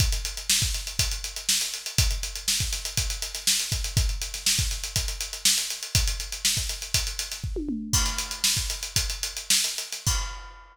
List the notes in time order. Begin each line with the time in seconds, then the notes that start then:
0.00 kick, closed hi-hat
0.12 closed hi-hat
0.25 closed hi-hat
0.37 closed hi-hat
0.50 snare
0.62 kick, snare, closed hi-hat
0.74 snare, closed hi-hat
0.87 closed hi-hat
0.99 kick, closed hi-hat
1.11 closed hi-hat
1.24 closed hi-hat
1.36 closed hi-hat
1.49 snare
1.61 closed hi-hat
1.74 closed hi-hat
1.86 closed hi-hat
1.98 kick, closed hi-hat
2.11 closed hi-hat
2.23 closed hi-hat
2.35 closed hi-hat
2.48 snare
2.60 kick, closed hi-hat
2.73 snare, closed hi-hat
2.85 closed hi-hat
2.97 kick, closed hi-hat
3.10 closed hi-hat
3.22 closed hi-hat
3.35 snare, closed hi-hat
3.47 snare
3.60 closed hi-hat
3.72 kick, closed hi-hat
3.84 closed hi-hat
3.97 kick, closed hi-hat
4.09 closed hi-hat
4.21 closed hi-hat
4.34 snare, closed hi-hat
4.46 snare
4.59 kick, closed hi-hat
4.71 closed hi-hat
4.84 closed hi-hat
4.96 kick, closed hi-hat
5.08 closed hi-hat
5.21 closed hi-hat
5.33 closed hi-hat
5.45 snare
5.58 closed hi-hat
5.70 closed hi-hat
5.83 closed hi-hat
5.95 kick, closed hi-hat
6.07 closed hi-hat
6.20 closed hi-hat
6.32 closed hi-hat
6.45 snare
6.57 kick, snare, closed hi-hat
6.69 closed hi-hat
6.82 closed hi-hat
6.94 kick, closed hi-hat
7.07 closed hi-hat
7.19 snare, closed hi-hat
7.32 snare, closed hi-hat
7.44 kick
7.56 high tom
7.69 mid tom
7.93 kick, crash
8.06 snare, closed hi-hat
8.18 closed hi-hat
8.31 closed hi-hat
8.44 snare
8.57 kick, closed hi-hat
8.70 closed hi-hat
8.83 closed hi-hat
8.96 kick, closed hi-hat
9.10 closed hi-hat
9.23 closed hi-hat
9.37 closed hi-hat
9.50 snare
9.64 closed hi-hat
9.78 closed hi-hat
9.92 snare, closed hi-hat
10.07 kick, crash